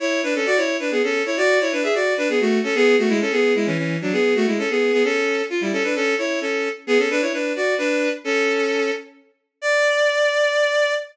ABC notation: X:1
M:3/4
L:1/16
Q:1/4=131
K:A
V:1 name="Violin"
[Ec]2 [DB] [CA] [Fd] [Ec]2 [DB] [B,G] [CA]2 [Ec] | [Fd]2 [Ec] [DB] [Ge] [Fd]2 [DB] [B,G] [A,F]2 [CA] | [B,G]2 [A,F] [G,E] [CA] [B,G]2 [G,E] [E,C] [E,C]2 [F,D] | [B,G]2 [A,F] [G,E] [CA] [B,G]2 [B,G] [CA]4 |
[K:D] =F [G,E] [CA] [DB] [CA]2 [Ec]2 [CA]3 z | [B,^G] [CA] [DB] [Ec] [DB]2 [Fd]2 [DB]3 z | [CA]6 z6 | d12 |]